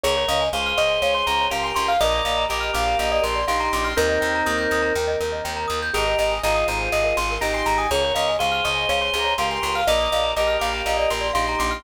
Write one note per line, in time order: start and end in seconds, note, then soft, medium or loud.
0.03 0.25 C#2 loud
0.03 0.15 G#4 medium
0.03 0.44 A#4 medium
0.03 0.26 C#5 medium
0.03 0.44 C#5 medium
0.17 0.28 C#5 medium
0.28 0.49 C#2 loud
0.28 0.49 D#5 medium
0.28 0.40 F5 medium
0.41 0.52 G#5 medium
0.53 0.74 C#2 medium
0.53 1.48 G#4 medium
0.53 1.48 C5 medium
0.53 0.77 F5 medium
0.53 0.66 C#6 medium
0.66 0.77 F6 medium
0.77 0.99 C#2 medium
0.77 1.00 D#5 medium
0.77 0.88 C#6 medium
0.89 1.00 G#5 medium
1.02 1.23 C#2 medium
1.02 1.14 C#5 medium
1.02 1.13 F5 medium
1.14 1.25 C#5 medium
1.14 1.26 C6 medium
1.27 1.48 C#2 medium
1.27 1.38 G#4 medium
1.27 1.46 A#5 medium
1.40 1.51 C#5 medium
1.50 1.72 C#2 medium
1.50 1.93 G4 medium
1.50 1.93 A#4 medium
1.50 1.62 F5 medium
1.50 1.63 C6 medium
1.64 1.75 G#5 medium
1.64 1.75 C6 medium
1.74 1.97 C#2 medium
1.74 1.87 C6 medium
1.74 1.85 C#6 medium
1.88 2.00 F5 loud
1.88 2.00 F6 medium
2.00 2.22 A#1 loud
2.00 2.44 A#4 medium
2.00 2.14 A#4 loud
2.00 2.44 D5 medium
2.00 2.24 D#5 loud
2.15 2.26 D5 medium
2.25 2.46 A#1 medium
2.25 2.46 D#5 medium
2.25 2.36 F5 medium
2.37 2.48 A#5 medium
2.49 2.71 A#1 medium
2.49 3.39 G4 medium
2.49 3.39 A#4 medium
2.49 2.71 D#5 medium
2.49 2.62 D6 medium
2.60 2.72 F6 medium
2.73 2.95 A#1 loud
2.73 2.98 F5 medium
2.73 2.85 D6 medium
2.88 2.99 A#5 medium
2.99 3.20 A#1 medium
2.99 3.11 D#5 medium
2.99 3.10 F5 medium
3.12 3.23 D5 medium
3.12 3.23 D#5 medium
3.22 3.44 A#1 medium
3.22 3.33 A#4 medium
3.22 3.45 C6 medium
3.35 3.46 D5 medium
3.47 3.69 A#1 medium
3.47 3.91 D#4 medium
3.47 3.91 G4 medium
3.47 3.59 F5 medium
3.47 3.60 C6 medium
3.60 3.71 A#5 medium
3.60 3.72 C6 medium
3.73 3.94 A#1 loud
3.73 3.85 C6 medium
3.73 3.85 D6 medium
3.84 3.97 C6 medium
3.84 3.95 F6 medium
3.97 4.18 D#2 loud
3.97 4.93 C4 medium
3.97 4.93 D#4 medium
3.97 4.08 A#4 medium
3.97 5.81 A#4 loud
4.09 4.20 D#5 medium
4.21 4.43 D#2 medium
4.21 4.32 G5 medium
4.35 4.46 A#5 medium
4.46 4.67 D#2 loud
4.46 4.57 D#6 medium
4.58 4.69 G6 medium
4.71 4.92 D#2 medium
4.71 4.83 D#6 medium
4.82 4.93 A#5 medium
4.95 5.16 D#2 medium
4.95 5.07 G5 medium
5.07 5.18 D#5 medium
5.20 5.41 D#2 medium
5.20 5.31 A#4 medium
5.32 5.43 D#5 medium
5.45 5.66 D#2 medium
5.45 5.56 G5 medium
5.56 5.67 A#5 medium
5.68 5.91 D#2 medium
5.68 5.79 D#6 medium
5.82 5.93 G6 medium
5.94 6.15 G#1 loud
5.94 6.35 G4 medium
5.94 6.05 G#4 medium
5.94 6.35 A#4 medium
5.94 6.18 D#5 medium
6.06 6.17 A#4 medium
6.19 6.39 G#1 medium
6.19 6.42 D#5 medium
6.19 6.31 D#5 medium
6.31 6.42 G#5 medium
6.43 6.64 G#1 loud
6.43 7.35 F4 medium
6.43 7.35 G#4 medium
6.43 6.67 D#5 medium
6.43 6.56 A#5 medium
6.55 6.66 D#6 medium
6.68 6.89 G#1 medium
6.68 6.90 C5 medium
6.68 6.79 A#5 medium
6.80 6.91 G#5 medium
6.92 7.13 G#1 medium
6.92 7.04 D#5 medium
7.04 7.15 A#4 medium
7.04 7.16 D#5 medium
7.16 7.38 G#1 loud
7.16 7.28 G#4 medium
7.16 7.41 C6 medium
7.31 7.42 A#4 medium
7.41 7.63 G#1 medium
7.41 7.87 D#4 medium
7.41 7.87 G4 medium
7.41 7.53 D#5 medium
7.41 7.53 A#5 medium
7.53 7.64 G#5 medium
7.53 7.66 C6 medium
7.66 7.87 G#1 medium
7.66 7.78 A#5 medium
7.78 7.90 G#5 medium
7.78 7.89 D#6 medium
7.91 8.12 C#2 loud
7.91 8.03 G#4 medium
7.91 8.31 A#4 medium
7.91 8.31 C#5 medium
7.91 8.14 C#5 medium
8.04 8.15 C#5 medium
8.15 8.36 C#2 loud
8.15 8.36 D#5 medium
8.15 8.26 F5 medium
8.28 8.39 G#5 medium
8.39 8.61 C#2 medium
8.39 9.34 G#4 medium
8.39 9.34 C5 medium
8.39 8.64 F5 medium
8.39 8.52 C#6 medium
8.52 8.63 F6 medium
8.64 8.86 C#2 medium
8.64 8.87 D#5 medium
8.64 8.75 C#6 medium
8.75 8.86 G#5 medium
8.89 9.10 C#2 medium
8.89 9.01 C#5 medium
8.89 9.00 F5 medium
9.01 9.12 C#5 medium
9.01 9.13 C6 medium
9.13 9.35 C#2 medium
9.13 9.26 G#4 medium
9.13 9.33 A#5 medium
9.24 9.35 C#5 medium
9.38 9.59 C#2 medium
9.38 9.81 G4 medium
9.38 9.81 A#4 medium
9.38 9.50 F5 medium
9.38 9.50 C6 medium
9.50 9.61 G#5 medium
9.50 9.62 C6 medium
9.62 9.84 C#2 medium
9.62 9.75 C6 medium
9.62 9.73 C#6 medium
9.75 9.87 F5 loud
9.75 9.86 F6 medium
9.87 10.08 A#1 loud
9.87 10.31 A#4 medium
9.87 10.00 A#4 loud
9.87 10.31 D5 medium
9.87 10.10 D#5 loud
9.99 10.11 D5 medium
10.12 10.33 A#1 medium
10.12 10.32 D#5 medium
10.12 10.24 F5 medium
10.23 10.35 A#5 medium
10.36 10.57 A#1 medium
10.36 11.28 G4 medium
10.36 11.28 A#4 medium
10.36 10.57 D#5 medium
10.36 10.47 D6 medium
10.47 10.58 F6 medium
10.60 10.82 A#1 loud
10.60 10.84 F5 medium
10.60 10.71 D6 medium
10.74 10.85 A#5 medium
10.86 11.07 A#1 medium
10.86 10.98 D#5 medium
10.86 10.98 F5 medium
10.97 11.08 D5 medium
10.97 11.10 D#5 medium
11.10 11.31 A#1 medium
11.10 11.22 A#4 medium
11.10 11.32 C6 medium
11.21 11.32 D5 medium
11.33 11.56 A#1 medium
11.33 11.79 D#4 medium
11.33 11.79 G4 medium
11.33 11.44 F5 medium
11.33 11.47 C6 medium
11.47 11.59 A#5 medium
11.47 11.59 C6 medium
11.59 11.81 A#1 loud
11.59 11.72 C6 medium
11.59 11.70 D6 medium
11.71 11.83 C6 medium
11.71 11.82 F6 medium